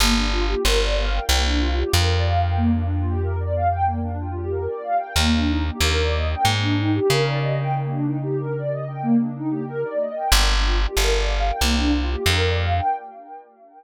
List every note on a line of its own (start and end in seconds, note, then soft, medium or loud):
0.00 0.55 G1 medium
0.00 0.14 A#3 loud
0.16 0.31 D4 medium
0.32 0.46 F4 medium
0.48 0.63 G4 medium
0.65 1.20 G1 medium
0.65 0.80 A#4 medium
0.81 0.95 D5 medium
0.98 1.12 F5 medium
1.13 1.28 G5 medium
1.29 1.84 C2 medium
1.29 1.43 A#3 medium
1.45 1.60 D4 medium
1.60 1.74 F4 medium
1.77 1.92 G4 medium
1.93 4.68 F2 medium
1.93 2.08 A#4 medium
2.10 2.24 D5 medium
2.26 2.41 F5 medium
2.41 2.55 G5 medium
2.57 2.71 A#3 medium
2.74 2.88 D4 medium
2.91 3.06 F4 medium
3.06 3.20 G4 medium
3.23 3.37 A#4 medium
3.40 3.54 D5 medium
3.55 3.69 F5 medium
3.71 3.85 G5 medium
3.85 4.00 A#3 medium
4.03 4.17 D4 medium
4.20 4.35 F4 medium
4.35 4.50 G4 medium
4.51 4.66 A#4 medium
4.68 4.83 D5 medium
4.83 4.97 F5 medium
4.98 5.13 G5 medium
5.16 5.71 D#2 medium
5.16 5.32 A#3 loud
5.33 5.48 D4 medium
5.47 5.62 D#4 medium
5.65 5.79 G4 medium
5.81 6.35 D#2 medium
5.81 5.95 A#4 medium
5.97 6.12 D5 medium
6.14 6.28 D#5 medium
6.30 6.45 G5 medium
6.43 7.00 G#2 medium
6.43 6.58 A#3 medium
6.62 6.77 D4 medium
6.78 6.93 D#4 medium
6.93 7.08 G4 medium
7.09 9.84 C#3 medium
7.09 7.24 A#4 medium
7.26 7.41 D5 medium
7.41 7.56 D#5 medium
7.57 7.72 G5 medium
7.76 7.90 A#3 medium
7.91 8.05 D4 medium
8.06 8.20 D#4 medium
8.23 8.37 G4 medium
8.39 8.54 A#4 medium
8.56 8.70 D5 medium
8.71 8.85 D#5 medium
8.88 9.02 G5 medium
9.02 9.17 A#3 medium
9.20 9.35 D4 medium
9.36 9.51 D#4 medium
9.51 9.65 G4 medium
9.67 9.81 A#4 loud
9.84 9.99 D5 medium
10.00 10.15 D#5 medium
10.16 10.30 G5 medium
10.32 10.87 G1 medium
10.32 10.47 A#3 medium
10.49 10.63 D4 medium
10.64 10.79 F4 medium
10.80 10.94 G4 medium
10.96 11.51 G1 medium
10.96 11.11 A#4 medium
11.13 11.27 D5 medium
11.28 11.43 F5 medium
11.47 11.61 G5 medium
11.61 12.16 C2 medium
11.61 11.76 A#3 medium
11.77 11.92 D4 medium
11.93 12.08 F4 medium
12.09 12.24 G4 medium
12.26 12.81 F2 medium
12.26 12.42 A#4 medium
12.41 12.56 D5 medium
12.59 12.73 F5 medium
12.74 12.88 G5 medium